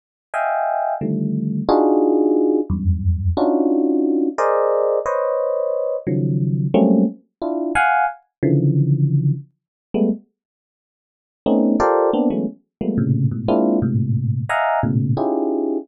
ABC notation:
X:1
M:5/8
L:1/16
Q:1/4=89
K:none
V:1 name="Electric Piano 1"
z2 [^defg^g]4 [=D,^D,F,=G,A,]4 | [D^DF^F^G]6 [E,,=F,,^F,,=G,,]4 | [^CD^DF^F]6 [^G^A=c=d^d]4 | [Bc^c^d]6 [^C,^D,F,^F,]4 |
[^F,G,A,^A,C^C]2 z2 [DE=F]2 [f^f^g]2 z2 | [^C,D,E,F,]6 z3 [G,^G,A,B,] | z8 [A,B,C^C^D]2 | [FGA^Acd]2 [^A,B,CD] [E,^F,^G,=A,B,^C] z2 [=F,=G,^G,A,^A,B,] [=A,,^A,,=C,^C,]2 [^G,,=A,,B,,] |
[^G,^A,CDEF]2 [^G,,=A,,^A,,C,]4 [^def^f^g^a]2 [=A,,^A,,B,,^C,]2 | [^C^DEFG^G]4 z6 |]